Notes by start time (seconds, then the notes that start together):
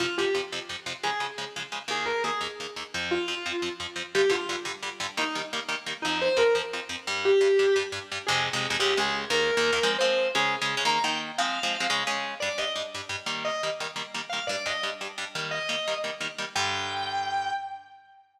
0.00 F2 C3 F3 F4
0.18 F2 C3 F3 G4
0.35 F2 C3 F3
0.52 F2 C3 F3
0.69 F2 C3 F3
0.86 F2 C3 F3
1.03 C#3 F3 G#3 G#4
1.20 C#3 F3 G#3
1.38 C#3 F3 G#3
1.56 C#3 F3 G#3
1.72 C#3 F3 G#3
1.88 D#2 D#3 A#3 G#4
2.06 A#4
2.24 D#2 D#3 A#3 G#4
2.41 D#2 D#3 A#3
2.60 D#2 D#3 A#3
2.76 D#2 D#3 A#3
2.94 F2 F3 C4
3.11 F4
3.28 F2 F3 C4
3.46 F2 F3 C4
3.62 F2 F3 C4
3.80 F2 F3 C4
3.96 F2 F3 C4
4.15 G2 D3 G3 G4
4.30 G2 D3 G3 F4
4.49 G2 D3 G3
4.65 G2 D3 G3
4.83 G2 D3 G3
5.00 G2 D3 G3
5.17 D#3 G3 A#3 D#4
5.35 D#3 G3 A#3
5.53 D#3 G3 A#3
5.69 D#3 G3 A#3
5.86 D#3 G3 A#3
6.02 F2 F3 C4 D#4
6.21 C5
6.37 F2 F3 C4 A#4
6.55 F2 F3 C4
6.73 F2 F3 C4
6.89 F2 F3 C4
7.07 G2 G3 D4
7.25 G4
7.41 G2 G3 D4
7.59 G2 G3 D4
7.76 G2 G3 D4
7.92 G2 G3 D4
8.12 G2 G3 D4
8.27 F2 C3 G#3 G#4
8.53 F2 C3 G#3
8.70 F2 C3 G#3
8.80 C#2 C#3 G#3 G4
8.97 C#2 C#3 G#3 G#4
9.30 D#2 D#3 A#3 A#4
9.57 D#2 D#3 A#3
9.72 D#2 D#3 A#3
9.83 F3 G#3 C4
9.99 F3 G#3 C4 C5
10.35 C#3 G#3 C#4 G#4
10.61 C#3 G#3 C#4
10.77 C#3 G#3 C#4
10.85 D#3 A#3 D#4 A#5
11.04 D#3 A#3 D#4 G5
11.38 F3 G#3 C4 F5
11.63 F3 G#3 C4
11.80 F3 G#3 C4
11.90 C#3 G#3 C#4
12.07 C#3 G#3 C#4
12.40 G2 G3 D4 D5
12.58 G2 G3 D4 D#5
12.76 G2 G3 D4
12.94 G2 G3 D4
13.09 G2 G3 D4
13.26 D#3 G3 A#3
13.45 D#5
13.63 D#3 G3 A#3
13.80 D#3 G3 A#3
13.96 D#3 G3 A#3
14.14 D#3 G3 A#3
14.29 D#3 G3 A#3 F5
14.47 G2 G3 D4 D5
14.66 G2 G3 D4 D#5
14.83 G2 G3 D4
15.01 G2 G3 D4
15.18 G2 G3 D4
15.35 D#3 G3 A#3
15.51 D#5
15.69 D#3 G3 A#3
15.88 D#3 G3 A#3
16.04 D#3 G3 A#3
16.20 D#3 G3 A#3
16.38 D#3 G3 A#3
16.56 G2 D3 G3 G5